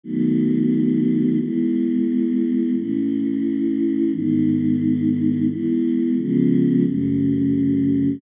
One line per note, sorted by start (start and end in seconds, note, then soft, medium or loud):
0.04 1.38 D#3 medium
0.04 1.38 F#3 medium
0.04 1.38 A3 medium
0.04 1.38 B3 medium
1.40 2.75 E3 medium
1.40 2.75 G#3 medium
1.40 2.75 B3 medium
2.76 4.11 A2 medium
2.76 4.11 E3 medium
2.76 4.11 C#4 medium
4.12 5.47 G#2 medium
4.12 5.47 D#3 medium
4.12 5.47 B3 medium
5.49 6.17 E3 medium
5.49 6.17 G#3 medium
5.49 6.17 B3 medium
6.17 6.85 C#3 medium
6.17 6.85 F3 medium
6.17 6.85 G#3 medium
6.17 6.85 B3 medium
6.85 8.20 F#2 medium
6.85 8.20 C#3 medium
6.85 8.20 A3 medium